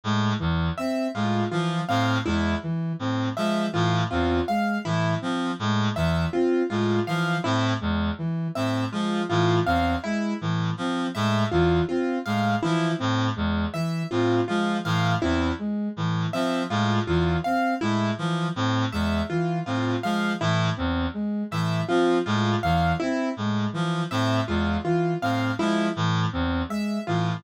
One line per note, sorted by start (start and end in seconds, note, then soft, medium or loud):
0.04 0.33 A2 medium
0.04 0.34 G#3 medium
0.39 0.70 E2 medium
0.39 0.69 E3 medium
0.78 1.08 C4 medium
0.78 1.07 E5 medium
1.15 1.44 A2 medium
1.15 1.44 G#3 medium
1.15 1.44 F4 medium
1.51 1.81 E3 medium
1.51 1.81 F3 medium
1.51 1.81 F4 medium
1.88 2.19 A2 medium
1.88 2.18 C4 medium
1.88 2.18 F5 medium
2.25 2.55 E2 medium
2.25 2.55 G#3 medium
2.25 2.55 E4 medium
2.63 2.93 E3 medium
2.99 3.29 A2 medium
2.99 3.29 C4 medium
3.36 3.66 F3 medium
3.36 3.67 G#3 medium
3.36 3.67 E5 medium
3.73 4.04 A2 medium
3.73 4.02 E3 medium
3.73 4.03 F4 medium
4.10 4.41 E2 medium
4.10 4.40 C4 medium
4.10 4.40 F4 medium
4.48 4.78 G#3 medium
4.48 4.78 F5 medium
4.85 5.15 A2 medium
4.85 5.14 E3 medium
4.85 5.15 E4 medium
5.21 5.52 F3 medium
5.21 5.51 C4 medium
5.59 5.89 A2 medium
5.59 5.90 G#3 medium
5.96 6.26 E2 medium
5.96 6.26 E3 medium
5.96 6.26 E5 medium
6.33 6.63 C4 medium
6.33 6.63 F4 medium
6.70 7.00 A2 medium
6.70 7.00 G#3 medium
6.70 7.00 F4 medium
7.07 7.37 E3 medium
7.07 7.37 F3 medium
7.07 7.37 F5 medium
7.44 7.74 A2 medium
7.44 7.73 C4 medium
7.44 7.74 E4 medium
7.81 8.11 E2 medium
7.81 8.10 G#3 medium
8.18 8.48 E3 medium
8.55 8.85 A2 medium
8.55 8.85 C4 medium
8.55 8.85 E5 medium
8.92 9.22 F3 medium
8.92 9.21 G#3 medium
8.92 9.22 F4 medium
9.29 9.59 A2 medium
9.29 9.60 E3 medium
9.29 9.59 F4 medium
9.66 9.96 E2 medium
9.66 9.95 C4 medium
9.66 9.96 F5 medium
10.04 10.34 G#3 medium
10.04 10.33 E4 medium
10.41 10.71 A2 medium
10.41 10.71 E3 medium
10.77 11.07 F3 medium
10.77 11.08 C4 medium
11.15 11.45 A2 medium
11.15 11.45 G#3 medium
11.15 11.44 E5 medium
11.51 11.81 E2 medium
11.51 11.82 E3 medium
11.51 11.81 F4 medium
11.89 12.19 C4 medium
11.89 12.18 F4 medium
12.26 12.55 A2 medium
12.26 12.56 G#3 medium
12.26 12.55 F5 medium
12.63 12.93 E3 medium
12.63 12.92 F3 medium
12.63 12.92 E4 medium
12.98 13.30 A2 medium
12.98 13.28 C4 medium
13.36 13.66 E2 medium
13.36 13.66 G#3 medium
13.74 14.03 E3 medium
13.74 14.03 E5 medium
14.11 14.41 A2 medium
14.11 14.41 C4 medium
14.11 14.41 F4 medium
14.48 14.78 F3 medium
14.48 14.78 G#3 medium
14.48 14.77 F4 medium
14.85 15.15 A2 medium
14.85 15.14 E3 medium
14.85 15.15 F5 medium
15.21 15.52 E2 medium
15.21 15.51 C4 medium
15.21 15.52 E4 medium
15.59 15.89 G#3 medium
15.97 16.26 A2 medium
15.97 16.27 E3 medium
16.33 16.63 F3 medium
16.33 16.63 C4 medium
16.33 16.63 E5 medium
16.70 17.00 A2 medium
16.70 17.00 G#3 medium
16.70 17.00 F4 medium
17.07 17.36 E2 medium
17.07 17.38 E3 medium
17.07 17.37 F4 medium
17.44 17.75 C4 medium
17.44 17.74 F5 medium
17.81 18.11 A2 medium
17.81 18.11 G#3 medium
17.81 18.11 E4 medium
18.18 18.48 E3 medium
18.18 18.48 F3 medium
18.56 18.85 A2 medium
18.56 18.85 C4 medium
18.92 19.22 E2 medium
18.92 19.22 G#3 medium
18.92 19.22 E5 medium
19.30 19.60 E3 medium
19.30 19.59 F4 medium
19.66 19.96 A2 medium
19.66 19.96 C4 medium
19.66 19.96 F4 medium
20.03 20.33 F3 medium
20.03 20.33 G#3 medium
20.03 20.33 F5 medium
20.40 20.70 A2 medium
20.40 20.70 E3 medium
20.40 20.71 E4 medium
20.77 21.07 E2 medium
20.77 21.06 C4 medium
21.14 21.43 G#3 medium
21.51 21.81 A2 medium
21.51 21.81 E3 medium
21.51 21.82 E5 medium
21.88 22.18 F3 medium
21.88 22.18 C4 medium
21.88 22.18 F4 medium
22.26 22.56 A2 medium
22.26 22.55 G#3 medium
22.26 22.56 F4 medium
22.63 22.93 E2 medium
22.63 22.94 E3 medium
22.63 22.93 F5 medium
23.00 23.31 C4 medium
23.00 23.29 E4 medium
23.37 23.66 A2 medium
23.37 23.68 G#3 medium
23.73 24.03 E3 medium
23.73 24.04 F3 medium
24.11 24.41 A2 medium
24.11 24.40 C4 medium
24.11 24.41 E5 medium
24.48 24.77 E2 medium
24.48 24.77 G#3 medium
24.48 24.78 F4 medium
24.84 25.14 E3 medium
24.84 25.14 F4 medium
25.22 25.52 A2 medium
25.22 25.51 C4 medium
25.22 25.52 F5 medium
25.59 25.88 F3 medium
25.59 25.88 G#3 medium
25.59 25.89 E4 medium
25.96 26.26 A2 medium
25.96 26.26 E3 medium
26.32 26.63 E2 medium
26.32 26.62 C4 medium
26.69 26.99 G#3 medium
26.69 27.00 E5 medium
27.07 27.37 A2 medium
27.07 27.37 E3 medium
27.07 27.37 F4 medium